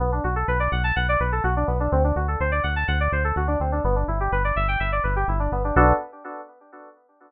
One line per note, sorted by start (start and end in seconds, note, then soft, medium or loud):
0.00 0.20 B1 medium
0.00 0.11 B3 medium
0.12 0.23 D4 medium
0.24 0.44 B1 medium
0.24 0.35 F#4 medium
0.36 0.47 A4 medium
0.48 0.68 B1 medium
0.48 0.59 B4 medium
0.60 0.70 D5 medium
0.72 0.92 B1 medium
0.72 0.83 F#5 medium
0.84 0.95 A5 medium
0.96 1.17 B1 medium
0.96 1.07 F#5 medium
1.09 1.20 D5 medium
1.20 1.40 B1 medium
1.20 1.31 B4 medium
1.32 1.43 A4 medium
1.44 1.64 B1 medium
1.44 1.54 F#4 medium
1.56 1.67 D4 medium
1.67 1.88 B1 medium
1.67 1.78 B3 medium
1.80 1.91 D4 medium
1.92 2.12 D2 medium
1.92 2.03 C4 medium
2.04 2.15 D4 medium
2.16 2.36 D2 medium
2.16 2.27 F#4 medium
2.28 2.39 A4 medium
2.40 2.60 D2 medium
2.40 2.51 C5 medium
2.52 2.62 D5 medium
2.63 2.84 D2 medium
2.63 2.74 F#5 medium
2.76 2.87 A5 medium
2.88 3.08 D2 medium
2.88 2.99 F#5 medium
3.00 3.11 D5 medium
3.12 3.33 D2 medium
3.12 3.23 C5 medium
3.24 3.35 A4 medium
3.36 3.56 D2 medium
3.36 3.47 F#4 medium
3.47 3.58 D4 medium
3.60 3.80 D2 medium
3.60 3.71 C4 medium
3.72 3.83 D4 medium
3.84 4.04 G1 medium
3.84 3.95 B3 medium
3.96 4.06 D4 medium
4.08 4.28 G1 medium
4.08 4.19 E4 medium
4.20 4.31 G4 medium
4.32 4.53 G1 medium
4.32 4.43 B4 medium
4.44 4.55 D5 medium
4.56 4.76 G1 medium
4.56 4.67 E5 medium
4.68 4.79 G5 medium
4.80 5.00 G1 medium
4.80 4.91 E5 medium
4.92 5.03 D5 medium
5.04 5.24 G1 medium
5.04 5.14 B4 medium
5.16 5.27 G4 medium
5.28 5.48 G1 medium
5.28 5.39 E4 medium
5.39 5.50 D4 medium
5.52 5.72 G1 medium
5.52 5.63 B3 medium
5.64 5.75 D4 medium
5.76 5.93 B1 loud
5.76 5.93 B3 medium
5.76 5.93 D4 loud
5.76 5.93 F#4 loud
5.76 5.93 A4 medium